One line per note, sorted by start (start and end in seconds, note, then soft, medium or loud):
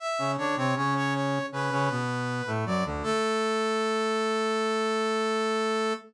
0.00 0.31 E5 medium
0.19 0.37 C#3 medium
0.19 0.37 C#4 medium
0.37 0.56 D3 medium
0.37 0.56 D4 loud
0.37 0.55 C#5 medium
0.56 0.75 C3 medium
0.56 0.75 C4 loud
0.56 0.75 C#5 medium
0.76 1.39 C#3 loud
0.76 1.39 C#4 loud
0.76 0.94 C#5 medium
0.96 1.14 C#5 medium
1.14 1.46 C#5 medium
1.52 1.70 C#3 medium
1.52 1.70 C#4 loud
1.52 2.50 B4 medium
1.71 1.89 C#3 loud
1.71 1.89 C#4 loud
1.90 2.42 B2 medium
1.90 2.42 B3 loud
2.47 2.65 A2 medium
2.47 2.65 A3 loud
2.66 2.84 F#2 medium
2.66 2.84 F#3 loud
2.66 2.84 D5 medium
2.85 3.03 D2 loud
2.85 3.03 D3 loud
3.03 5.94 A3 loud
3.03 5.93 A4 loud